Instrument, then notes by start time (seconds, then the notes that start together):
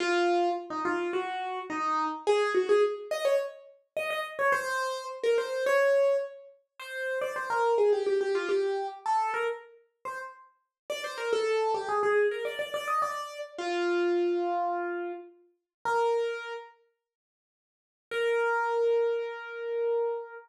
acoustic grand piano
0.00 F4
0.70 D#4
0.85 F4
1.13 F#4
1.70 D#4
2.27 G#4
2.54 F#4
2.69 G#4
3.11 D#5
3.25 C#5
3.97 D#5
4.10 D#5
4.39 C#5
4.52 C5
5.23 A#4
5.38 C5
5.66 C#5
6.79 C5
7.21 D5
7.36 C5
7.50 A#4
7.78 G#4
7.93 G4
8.06 G4
8.21 G4
8.35 F4
8.49 G4
9.06 A4
9.34 A#4
10.05 C5
10.90 D5
11.04 C5
11.18 A#4
11.33 A4
11.74 G4
11.89 G#4
12.03 G#4
12.31 A#4
12.45 D5
12.59 D5
12.74 D5
12.88 D#5
13.02 D5
13.58 F4
15.85 A#4
18.11 A#4